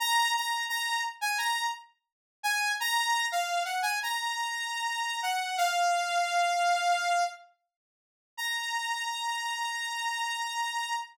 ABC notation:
X:1
M:4/4
L:1/16
Q:1/4=86
K:Bbm
V:1 name="Lead 2 (sawtooth)"
b2 b2 b2 z a b2 z4 a2 | b3 f2 g a b7 g2 | f10 z6 | b16 |]